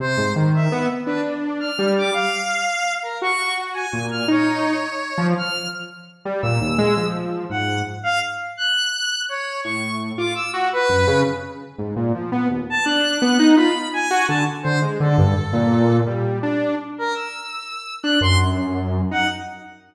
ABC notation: X:1
M:6/8
L:1/8
Q:3/8=112
K:none
V:1 name="Lead 2 (sawtooth)"
C, ^G,, ^D,2 B, z | D4 G,2 | z6 | ^F4 ^A,,2 |
^D3 z2 F, | z5 G, | ^A,, ^D,, ^G, F,3 | ^G,,2 z4 |
z6 | A,,3 F z ^F | z ^F,, ^C, z3 | ^G,, ^A,, F, B, ^D,, z |
D2 B, ^D F z | z ^F D, z D, ^G, | D, G,, z ^A,,3 | G,2 D2 z2 |
z5 D | ^F,,5 ^D |]
V:2 name="Lead 1 (square)"
c2 z e2 z | B z2 f'2 d' | f5 ^A | ^c'2 z ^g2 f' |
^c6 | f'2 z4 | e'4 z2 | ^f2 z =f z2 |
^f'4 ^c2 | ^c'2 z d' e' z | B3 z3 | z5 a |
^f'4 b2 | ^g2 a z c z | A6 | z5 ^A |
e'5 ^f' | c' z4 ^f |]